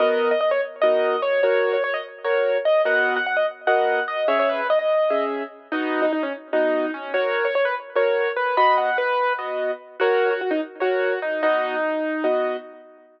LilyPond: <<
  \new Staff \with { instrumentName = "Acoustic Grand Piano" } { \time 7/8 \key b \major \tempo 4 = 147 dis''8. dis''16 dis''16 cis''16 r8 dis''4 cis''8 | cis''8. cis''16 cis''16 dis''16 r8 cis''4 dis''8 | fis''8. fis''16 fis''16 dis''16 r8 fis''4 dis''8 | cis''16 cis''16 b'8 dis''16 dis''4~ dis''16 r4 |
dis'8. dis'16 dis'16 cis'16 r8 dis'4 cis'8 | cis''8. cis''16 cis''16 b'16 r8 cis''4 b'8 | b''8 fis''8 b'4 r4. | fis'8. fis'16 fis'16 dis'16 r8 fis'4 dis'8 |
dis'2~ dis'8 r4 | }
  \new Staff \with { instrumentName = "Acoustic Grand Piano" } { \time 7/8 \key b \major <b fis' ais'>2 <b dis' fis' ais'>4. | <fis' ais'>2 <fis' ais'>4. | <b fis' ais' dis''>2 <b fis' ais' dis''>4. | <cis' gis' e''>2 <cis' gis' e''>4. |
<b fis' dis''>2 <b fis' dis''>4. | <fis' ais'>2 <fis' ais'>4. | <b fis' dis''>2 <b fis' dis''>4. | <fis' ais' cis''>2 <ais' cis''>4. |
<b fis' dis''>2 <b fis' dis''>4. | }
>>